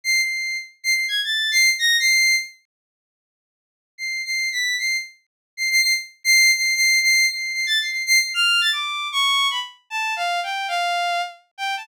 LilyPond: \new Staff { \time 5/4 \tempo 4 = 152 c''''8 c''''4 r8 \tuplet 3/2 { c''''8 c''''8 aes'''8 } a'''8. c''''8 r16 bes'''8 | c''''4 r1 | \tuplet 3/2 { c''''4 c''''4 b'''4 } c''''8 r4. \tuplet 3/2 { c''''8 c''''8 c''''8 } | r8. c''''8. c''''8 \tuplet 3/2 { c''''4 c''''4 c''''4 c''''8 a'''8 c''''8 } |
\tuplet 3/2 { c''''8 c''''8 c''''8 } f'''8. a'''16 d'''4 des'''4 b''16 r8. | \tuplet 3/2 { a''4 f''4 g''4 } f''4. r8. g''8 a''16 | }